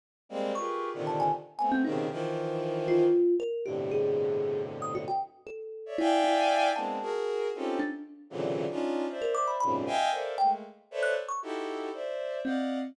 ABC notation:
X:1
M:3/4
L:1/16
Q:1/4=116
K:none
V:1 name="Violin"
z2 [G,^G,^A,C]2 | [FG^G^AB]3 [^A,,C,D,^D,]3 z2 [=A,B,C]2 [B,,C,^C,D,]2 | [^D,E,F,]8 z4 | [G,,A,,B,,C,D,]12 |
z5 [^cde] [defg^g]6 | [^G,^A,B,CD]2 [^F^G^A]4 [C^C^D=F=G=A]2 z4 | [^A,,C,^C,D,E,^F,]3 [^CD^D=F]3 [=c=de]4 [^F,,^G,,A,,B,,=C,^C,]2 | [^defg^g]2 [A^Ac=def]2 [^G,=A,^A,]2 z2 [=ABc^cde]2 z2 |
[^DE^FGA]4 [c=de]4 [d^d=f^f]3 z |]
V:2 name="Kalimba"
z4 | ^c'3 z a ^g z2 g =C ^D2 | z6 F4 ^A2 | G2 ^G6 z ^d' ^F =g |
z2 A4 E2 E4 | a3 z5 D z3 | z7 ^A d' b b z | z4 g z4 ^f' z ^c' |
z8 C4 |]